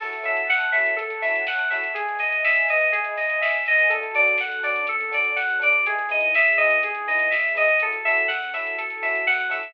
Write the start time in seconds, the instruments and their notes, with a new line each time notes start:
0.00 synth bass 2 F#2, electric piano 1 C#4 E4 F#4 A4, electric piano 2 A4, pad 2 (warm) C#5 E5 F#5 A5, kick, crash
0.13 closed hi-hat
0.23 electric piano 1 C#4 E4 F#4 A4, electric piano 2 E5, open hi-hat
0.37 closed hi-hat
0.49 electric piano 2 F#5, kick, snare
0.60 closed hi-hat
0.72 electric piano 1 C#4 E4 F#4 A4, electric piano 2 E5, open hi-hat
0.86 closed hi-hat
0.96 synth bass 2 F#2, electric piano 2 A4, kick, closed hi-hat
1.10 closed hi-hat
1.22 electric piano 1 C#4 E4 F#4 A4, electric piano 2 E5, open hi-hat
1.35 closed hi-hat
1.47 electric piano 2 F#5, kick, snare
1.59 closed hi-hat
1.70 electric piano 1 C#4 E4 F#4 A4, electric piano 2 E5, open hi-hat
1.83 closed hi-hat
1.94 synth bass 2 G#1, electric piano 2 G#4, pad 2 (warm) B4 D#5 E5 G#5, kick, closed hi-hat
2.08 closed hi-hat
2.19 electric piano 2 D#5, open hi-hat
2.32 closed hi-hat
2.44 electric piano 2 E5, kick, snare
2.55 closed hi-hat
2.68 electric piano 2 D#5, open hi-hat
2.81 closed hi-hat
2.92 synth bass 2 G#1, electric piano 2 G#4, kick, closed hi-hat
3.04 closed hi-hat
3.17 electric piano 2 D#5, open hi-hat
3.29 closed hi-hat
3.41 synth bass 2 C2, electric piano 2 E5, kick, snare
3.53 closed hi-hat
3.65 synth bass 2 C#2, electric piano 2 D#5, open hi-hat
3.79 closed hi-hat
3.90 synth bass 2 D2, pad 2 (warm) C#4 D4 F#4 A4, electric piano 1 C#4 D4 F#4 A4, electric piano 2 A4, kick, closed hi-hat
4.03 closed hi-hat
4.14 electric piano 1 C#4 D4 F#4 A4, electric piano 2 D5, open hi-hat
4.27 closed hi-hat
4.38 electric piano 2 F#5, kick, snare
4.52 closed hi-hat
4.63 electric piano 1 C#4 D4 F#4 A4, electric piano 2 D5, open hi-hat
4.76 closed hi-hat
4.87 synth bass 2 D2, electric piano 2 A4, kick, closed hi-hat
5.00 closed hi-hat
5.11 electric piano 1 C#4 D4 F#4 A4, electric piano 2 D5, open hi-hat
5.24 closed hi-hat
5.36 electric piano 2 F#5, kick, snare
5.50 closed hi-hat
5.59 electric piano 1 C#4 D4 F#4 A4, electric piano 2 D5, open hi-hat
5.72 closed hi-hat
5.85 synth bass 2 E2, pad 2 (warm) B3 D#4 E4 G#4, electric piano 1 B3 D#4 E4 G#4, electric piano 2 G#4, kick, closed hi-hat
5.99 closed hi-hat
6.09 electric piano 1 B3 D#4 E4 G#4, electric piano 2 D#5, open hi-hat
6.21 closed hi-hat
6.34 electric piano 2 E5, kick, snare
6.47 closed hi-hat
6.57 electric piano 1 B3 D#4 E4 G#4, electric piano 2 D#5, open hi-hat
6.70 closed hi-hat
6.83 synth bass 2 E2, electric piano 2 G#4, kick, closed hi-hat
6.95 closed hi-hat
7.08 electric piano 1 B3 D#4 E4 G#4, electric piano 2 D#5, open hi-hat
7.19 closed hi-hat
7.30 electric piano 2 E5, kick, snare
7.44 closed hi-hat
7.55 electric piano 1 B3 D#4 E4 G#4, electric piano 2 D#5, open hi-hat
7.68 closed hi-hat
7.80 synth bass 2 F#2, electric piano 1 C#4 E4 F#4 A4, pad 2 (warm) C#4 E4 F#4 A4, electric piano 2 A4, kick, closed hi-hat
7.93 closed hi-hat
8.05 electric piano 1 C#4 E4 F#4 A4, electric piano 2 E5, open hi-hat
8.17 closed hi-hat
8.28 electric piano 2 F#5, kick, snare
8.42 closed hi-hat
8.54 electric piano 1 C#4 E4 F#4 A4, electric piano 2 E5, open hi-hat
8.66 closed hi-hat
8.78 synth bass 2 F#2, electric piano 2 A4, kick, closed hi-hat
8.90 closed hi-hat
9.02 electric piano 1 C#4 E4 F#4 A4, electric piano 2 E5, open hi-hat
9.15 closed hi-hat
9.27 electric piano 2 F#5, kick, snare
9.40 closed hi-hat
9.49 electric piano 1 C#4 E4 F#4 A4, electric piano 2 E5, open hi-hat
9.63 closed hi-hat